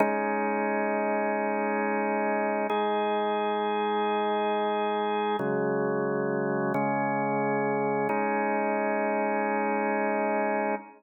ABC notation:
X:1
M:4/4
L:1/8
Q:1/4=89
K:Abmix
V:1 name="Drawbar Organ"
[A,DE]8 | [A,EA]8 | [D,G,A,]4 [D,A,D]4 | [A,DE]8 |]